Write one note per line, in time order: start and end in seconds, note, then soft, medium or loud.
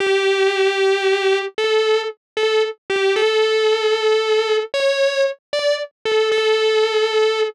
0.00 1.38 G4 loud
1.58 2.01 A4 medium
2.37 2.62 A4 medium
2.90 3.14 G4 loud
3.16 4.56 A4 loud
4.74 5.23 C#5 loud
5.53 5.75 D5 loud
6.05 6.29 A4 medium
6.31 7.41 A4 loud